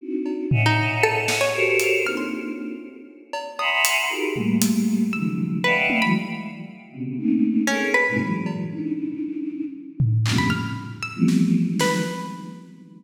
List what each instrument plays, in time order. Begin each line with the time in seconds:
0.01 choir aahs C4 D4 D#4 E4 F#4
0.26 cowbell
0.51 choir aahs C#5 D#5 E5 F#5 G#5, floor tom
0.66 pizzicato strings D#4
1.03 pizzicato strings A4
1.28 snare
1.41 pizzicato strings C#5
1.54 choir aahs F#4 G4 A4 A#4 C5 C#5
1.79 closed hi-hat
2.04 choir aahs A#3 C4 D4 D#4 F4, pizzicato strings F6
2.17 pizzicato strings C6
3.33 cowbell
3.59 choir aahs E5 F#5 G#5 A#5 B5 C6, pizzicato strings D#6, cowbell
3.85 closed hi-hat
4.09 choir aahs D#4 F4 F#4 G4 G#4 A#4
4.36 choir aahs G3 A3 A#3, floor tom
4.62 closed hi-hat
5.13 choir aahs C#3 D#3 F3 F#3 G#3 A3, pizzicato strings E6
5.64 pizzicato strings B4, choir aahs D5 D#5 E5 F5 F#5 G5
5.90 high tom
6.02 choir aahs E3 F#3 G#3, pizzicato strings B5
6.92 choir aahs B2 C3 C#3
7.17 choir aahs A3 A#3 C4 C#4 D#4
7.67 pizzicato strings C#4, choir aahs G#4 A4 A#4
7.94 pizzicato strings B4
8.08 choir aahs G#2 A2 A#2 C3
8.20 choir aahs E3 F#3 G#3
8.46 cowbell
8.71 choir aahs C#4 D4 D#4 E4
10.00 floor tom
10.26 choir aahs F2 G2 A2 A#2 C3 C#3, clap
10.38 pizzicato strings B5
10.50 pizzicato strings F6
11.03 pizzicato strings E6
11.15 choir aahs E3 F3 G3 A3 B3 C4
11.28 snare
11.67 choir aahs D#3 F3 F#3 G#3
11.79 pizzicato strings B4, snare